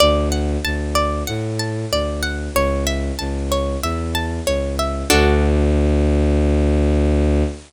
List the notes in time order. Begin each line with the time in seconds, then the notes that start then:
0.00 D2 D5
0.32 F#5
0.65 D2 A5
0.95 D5
1.27 A2 F#5
1.59 A5
1.91 D2 D5
2.23 F#5
2.54 C#2 C#5
2.87 E5
3.19 C#2 A5
3.52 C#5
3.82 E2 E5
4.15 A5
4.46 C#2 C#5
4.79 E5
5.10 D2 D4 F#4 A4